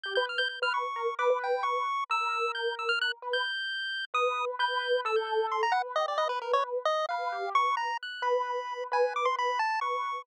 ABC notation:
X:1
M:9/8
L:1/16
Q:3/8=88
K:none
V:1 name="Acoustic Grand Piano"
G B z B z B2 z _B z =B B3 B2 z2 | _B10 =B2 z6 | B4 B4 A6 B2 G2 | B6 z2 B2 G2 B3 z3 |
B6 B2 B B B2 z2 B4 |]
V:2 name="Lead 1 (square)"
g' g' f' g' g' f' _d'4 =d'2 g2 _d'4 | e'4 g'2 e' f' _g' z2 =g'7 | _e'3 z g'4 =e' g' g'2 c' _b _g z _e d | _e B _B _d z2 e2 f4 _d'2 _b2 _g'2 |
b6 _a2 d' c' b2 =a2 _d'4 |]